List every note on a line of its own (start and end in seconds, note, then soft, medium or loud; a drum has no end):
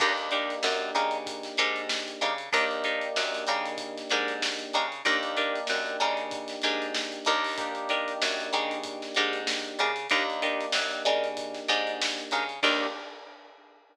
0.00 0.56 D#2 loud
0.00 2.28 A#3 medium
0.00 0.13 D4 medium
0.00 2.28 D4 medium
0.00 2.28 D#4 medium
0.00 0.13 D#4 medium
0.00 2.28 G4 medium
0.00 0.13 G4 medium
0.00 0.13 A#4 medium
0.00 kick loud
0.00 crash loud
0.17 closed hi-hat medium
0.31 0.55 D4 medium
0.31 0.55 D#4 medium
0.31 0.55 G4 medium
0.31 0.55 A#4 medium
0.31 closed hi-hat medium
0.50 closed hi-hat medium
0.63 0.91 F#2 loud
0.63 snare loud
0.95 1.50 C#3 loud
0.95 1.18 D4 medium
0.95 1.18 D#4 medium
0.95 1.18 G4 medium
0.95 1.18 A#4 medium
0.95 closed hi-hat medium
1.11 closed hi-hat medium
1.26 kick loud
1.26 closed hi-hat loud
1.43 snare medium
1.43 closed hi-hat medium
1.57 2.14 G#2 loud
1.57 1.81 D4 medium
1.57 1.81 D#4 medium
1.57 1.81 G4 medium
1.57 1.81 A#4 medium
1.57 closed hi-hat medium
1.76 closed hi-hat medium
1.89 snare loud
2.08 closed hi-hat medium
2.21 2.49 C#3 loud
2.21 2.34 D4 medium
2.21 2.34 D#4 medium
2.21 2.34 G4 medium
2.21 2.34 A#4 medium
2.21 closed hi-hat medium
2.38 closed hi-hat medium
2.53 3.08 D#2 loud
2.53 4.81 A#3 loud
2.53 4.81 D4 loud
2.53 2.65 D4 medium
2.53 4.81 D#4 loud
2.53 2.65 D#4 medium
2.53 4.81 G4 medium
2.53 2.65 G4 medium
2.53 2.65 A#4 medium
2.53 kick loud
2.53 closed hi-hat loud
2.71 closed hi-hat medium
2.84 3.08 D4 medium
2.84 3.08 D#4 medium
2.84 3.08 G4 medium
2.84 3.08 A#4 medium
2.84 closed hi-hat medium
3.01 closed hi-hat medium
3.16 3.44 F#2 loud
3.16 snare loud
3.34 snare soft
3.34 closed hi-hat medium
3.47 4.03 C#3 loud
3.47 3.70 D4 medium
3.47 3.70 D#4 medium
3.47 3.70 G4 medium
3.47 3.70 A#4 medium
3.47 closed hi-hat medium
3.66 closed hi-hat medium
3.78 kick medium
3.78 closed hi-hat loud
3.98 snare medium
3.98 closed hi-hat medium
4.10 4.66 G#2 medium
4.10 4.34 D4 medium
4.10 4.34 D#4 medium
4.10 4.34 G4 medium
4.10 4.34 A#4 medium
4.10 closed hi-hat medium
4.28 closed hi-hat medium
4.42 snare loud
4.59 closed hi-hat medium
4.73 5.02 C#3 loud
4.73 4.86 D4 medium
4.73 4.86 D#4 medium
4.73 4.86 G4 medium
4.73 4.86 A#4 medium
4.73 closed hi-hat medium
4.92 closed hi-hat medium
5.05 5.61 D#2 loud
5.05 7.33 A#3 medium
5.05 5.18 D4 medium
5.05 7.33 D4 loud
5.05 7.33 D#4 medium
5.05 5.18 D#4 medium
5.05 7.33 G4 loud
5.05 5.18 G4 medium
5.05 5.18 A#4 medium
5.05 kick loud
5.05 closed hi-hat loud
5.23 closed hi-hat medium
5.37 5.60 D4 medium
5.37 5.60 D#4 medium
5.37 5.60 G4 medium
5.37 5.60 A#4 medium
5.37 closed hi-hat medium
5.56 closed hi-hat medium
5.67 5.97 F#2 loud
5.67 snare loud
5.86 closed hi-hat medium
6.00 6.56 C#3 loud
6.00 6.23 D4 medium
6.00 6.23 D#4 medium
6.00 6.23 G4 medium
6.00 6.23 A#4 medium
6.00 closed hi-hat medium
6.17 closed hi-hat medium
6.31 kick loud
6.31 closed hi-hat loud
6.48 snare medium
6.48 closed hi-hat medium
6.62 7.19 G#2 loud
6.62 6.86 D4 medium
6.62 6.86 D#4 medium
6.62 6.86 G4 medium
6.62 6.86 A#4 medium
6.62 snare soft
6.62 closed hi-hat medium
6.82 closed hi-hat medium
6.94 snare loud
7.12 closed hi-hat medium
7.25 8.14 D#2 loud
7.25 7.70 D4 medium
7.25 7.70 D#4 medium
7.25 7.70 G4 medium
7.25 7.70 A#4 medium
7.25 closed hi-hat medium
7.44 open hi-hat medium
7.58 9.86 A#3 medium
7.58 9.86 D4 medium
7.58 9.86 D#4 medium
7.58 9.86 G4 loud
7.58 kick loud
7.58 closed hi-hat loud
7.75 closed hi-hat medium
7.89 8.13 D4 medium
7.89 8.13 D#4 medium
7.89 8.13 G4 medium
7.89 8.13 A#4 medium
7.89 closed hi-hat medium
8.08 closed hi-hat medium
8.22 8.50 F#2 loud
8.22 snare loud
8.40 closed hi-hat medium
8.53 9.08 C#3 loud
8.53 8.76 D4 medium
8.53 8.76 D#4 medium
8.53 8.76 G4 medium
8.53 8.76 A#4 medium
8.53 closed hi-hat medium
8.71 closed hi-hat medium
8.84 kick medium
8.84 closed hi-hat loud
9.02 snare medium
9.02 closed hi-hat medium
9.15 9.72 G#2 loud
9.15 9.39 D4 medium
9.15 9.39 D#4 medium
9.15 9.39 G4 medium
9.15 9.39 A#4 medium
9.15 closed hi-hat medium
9.33 closed hi-hat medium
9.47 snare loud
9.64 closed hi-hat medium
9.79 10.08 C#3 loud
9.79 9.91 D4 medium
9.79 9.91 D#4 medium
9.79 9.91 G4 medium
9.79 9.91 A#4 medium
9.79 closed hi-hat medium
9.96 closed hi-hat medium
10.10 10.66 D#2 loud
10.10 12.39 A#3 medium
10.10 12.39 D4 medium
10.10 10.23 D4 medium
10.10 12.39 D#4 medium
10.10 10.23 D#4 medium
10.10 12.39 G4 medium
10.10 10.23 G4 medium
10.10 10.23 A#4 medium
10.10 kick loud
10.10 closed hi-hat loud
10.30 closed hi-hat medium
10.42 10.66 D4 medium
10.42 10.66 D#4 medium
10.42 10.66 G4 medium
10.42 10.66 A#4 medium
10.42 closed hi-hat medium
10.61 closed hi-hat medium
10.72 11.02 F#2 medium
10.72 snare loud
10.91 snare soft
10.91 closed hi-hat medium
11.05 11.61 C#3 loud
11.05 11.28 D4 medium
11.05 11.28 D#4 medium
11.05 11.28 G4 medium
11.05 11.28 A#4 medium
11.05 snare soft
11.05 closed hi-hat medium
11.24 closed hi-hat medium
11.37 kick loud
11.37 closed hi-hat loud
11.54 snare medium
11.54 closed hi-hat medium
11.68 12.24 G#2 loud
11.68 11.92 D4 medium
11.68 11.92 D#4 medium
11.68 11.92 G4 medium
11.68 11.92 A#4 medium
11.68 closed hi-hat medium
11.87 closed hi-hat medium
12.01 snare loud
12.18 snare soft
12.18 closed hi-hat medium
12.31 12.60 C#3 loud
12.31 12.44 D4 medium
12.31 12.44 D#4 medium
12.31 12.44 G4 medium
12.31 12.44 A#4 medium
12.31 snare soft
12.31 closed hi-hat medium
12.49 closed hi-hat medium
12.63 12.87 D#2 loud
12.63 12.87 A#3 loud
12.63 12.86 D4 loud
12.63 12.87 D4 loud
12.63 12.86 D#4 loud
12.63 12.87 D#4 medium
12.63 12.87 G4 loud
12.63 12.86 G4 medium
12.63 12.86 A#4 loud
12.63 kick loud
12.63 crash loud